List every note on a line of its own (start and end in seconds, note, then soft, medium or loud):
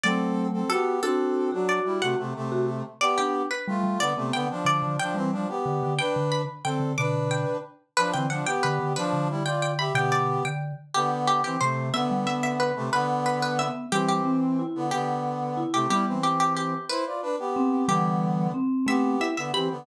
0.04 0.63 F#3 medium
0.04 0.63 A3 medium
0.04 0.48 C4 loud
0.04 0.48 A4 loud
0.04 0.61 D5 loud
0.53 0.69 C4 medium
0.53 0.69 A4 medium
0.70 1.01 B3 medium
0.70 0.96 F#4 medium
0.70 1.01 G4 loud
0.70 1.01 A4 loud
1.03 1.50 C4 loud
1.03 1.50 D4 medium
1.03 1.50 F#4 medium
1.03 1.50 A4 loud
1.03 1.67 A4 loud
1.52 1.80 F#3 medium
1.52 1.80 D4 loud
1.52 1.98 F#4 medium
1.69 1.98 D5 loud
1.85 2.01 G3 medium
1.85 2.01 E4 medium
2.02 2.15 C3 medium
2.02 2.15 A3 loud
2.02 2.18 F#4 medium
2.02 2.59 F#5 loud
2.19 2.34 C3 medium
2.19 2.34 A3 medium
2.36 2.83 C3 medium
2.36 2.83 A3 loud
2.52 2.66 F#4 medium
3.01 3.42 B3 loud
3.01 3.42 G4 loud
3.01 3.17 D5 loud
3.18 3.47 D4 medium
3.18 3.48 G4 loud
3.51 3.81 B4 medium
3.68 3.83 G3 medium
3.68 3.99 A3 medium
3.68 3.99 F4 loud
3.83 3.97 G3 medium
4.00 4.13 D3 loud
4.00 4.13 B3 loud
4.00 4.27 D5 loud
4.17 4.32 C3 medium
4.17 4.32 A3 loud
4.17 4.46 B3 medium
4.33 4.48 D3 loud
4.33 4.48 B3 loud
4.33 4.64 G5 medium
4.50 4.96 F3 loud
4.50 4.96 D4 loud
4.65 4.81 D3 medium
4.65 4.94 D5 loud
4.83 4.96 D3 medium
5.00 5.16 F3 loud
5.00 5.16 D4 loud
5.00 5.63 G5 loud
5.14 5.31 E3 medium
5.14 5.47 G3 medium
5.14 5.31 C4 loud
5.32 5.48 F3 medium
5.32 5.48 D4 loud
5.49 5.94 B3 medium
5.49 5.94 G4 loud
5.66 5.81 D3 medium
5.83 5.98 D3 medium
5.99 6.42 D4 loud
5.99 6.42 B4 loud
5.99 6.30 G5 loud
6.16 6.45 D3 medium
6.32 6.63 B5 medium
6.64 6.79 D3 medium
6.64 6.93 C4 medium
6.64 6.93 A4 loud
6.64 6.95 G5 medium
6.80 6.94 D3 medium
6.98 7.45 B2 medium
6.98 7.45 D3 medium
6.98 7.57 D4 loud
6.98 7.57 B4 loud
6.98 7.29 D6 loud
7.31 7.79 G5 medium
7.97 8.12 F3 loud
7.97 8.12 D4 loud
7.97 8.11 B4 loud
8.13 8.42 D3 medium
8.13 8.26 E3 medium
8.13 8.26 C4 loud
8.13 8.29 G5 medium
8.30 8.46 F3 medium
8.30 8.46 D4 loud
8.30 8.46 F#5 medium
8.46 8.93 B3 medium
8.46 8.93 G4 loud
8.46 8.62 G5 loud
8.63 8.79 D3 medium
8.63 8.92 B4 medium
8.80 8.94 D3 medium
8.96 9.28 F3 loud
8.96 9.28 D4 loud
8.96 9.12 B4 medium
9.13 9.89 D3 medium
9.30 9.43 G3 medium
9.30 9.43 E4 loud
9.45 9.71 F4 medium
9.45 9.71 D5 loud
9.45 9.59 G5 medium
9.62 9.76 G5 loud
9.79 9.93 G4 loud
9.79 9.93 E5 loud
9.79 9.95 B5 loud
9.95 10.39 B2 medium
9.95 10.39 D3 medium
9.95 10.43 B3 loud
9.95 10.43 G4 loud
9.95 10.11 G5 loud
10.12 10.39 D5 loud
10.45 10.72 D3 medium
10.45 10.74 G5 medium
10.94 11.41 D3 loud
10.94 11.41 B3 loud
10.94 11.10 G4 medium
11.27 11.43 G4 medium
11.44 11.57 E3 medium
11.44 11.57 C4 loud
11.44 11.59 G4 medium
11.61 11.89 C3 medium
11.61 11.90 C3 medium
11.61 11.89 A3 loud
11.61 11.93 C5 medium
11.94 12.72 D3 loud
11.94 12.72 B3 loud
11.94 12.10 B3 medium
11.94 12.08 E5 loud
12.11 12.25 G3 medium
12.26 12.53 B3 medium
12.26 12.41 E5 medium
12.43 12.58 E5 medium
12.60 12.89 B4 medium
12.76 12.90 C3 loud
12.76 12.90 A3 loud
12.93 13.68 D3 loud
12.93 13.68 B3 loud
12.93 13.07 B4 loud
13.26 13.39 B4 medium
13.42 13.58 B4 loud
13.59 13.86 B3 medium
13.59 13.88 E5 medium
13.92 14.63 E3 medium
13.92 14.21 E3 medium
13.92 14.21 G3 medium
13.92 14.63 C4 loud
13.92 14.08 G4 loud
14.09 14.39 G4 medium
14.25 14.56 C4 medium
14.59 14.86 E4 medium
14.75 14.91 D3 medium
14.75 14.91 B3 loud
14.91 15.63 D3 loud
14.91 15.63 B3 loud
14.91 15.72 G4 medium
15.57 15.85 E4 medium
15.73 15.87 C3 loud
15.73 15.87 A3 loud
15.73 15.88 G4 medium
15.90 16.17 G3 medium
15.90 16.05 G3 loud
15.90 16.17 B3 medium
15.90 16.05 E4 loud
15.90 16.05 G4 medium
16.07 16.74 E3 medium
16.07 16.74 C4 loud
16.23 16.39 G4 medium
16.40 16.54 G4 loud
16.57 16.85 G4 medium
16.89 17.05 E4 loud
16.89 17.82 B4 loud
16.89 17.05 C5 loud
17.06 17.21 F4 medium
17.06 17.21 D5 medium
17.22 17.36 D4 loud
17.22 17.36 B4 loud
17.39 17.87 B3 medium
17.39 17.87 G4 loud
17.56 17.85 C4 medium
17.88 18.52 D3 loud
17.88 18.47 E3 medium
17.88 18.47 G3 medium
17.88 18.52 B3 loud
17.88 18.43 G4 loud
18.54 18.86 C4 medium
18.87 19.16 A3 medium
18.87 19.28 B3 loud
18.87 19.16 C4 medium
18.87 19.28 G4 loud
18.87 19.02 E5 loud
19.20 19.35 E4 medium
19.20 19.36 E5 medium
19.37 19.52 D3 medium
19.37 19.52 B3 medium
19.37 19.52 E5 loud
19.54 19.69 E3 medium
19.54 19.69 C4 medium
19.54 19.67 G4 medium
19.54 19.85 B5 medium
19.71 19.85 D3 medium
19.71 19.85 B3 medium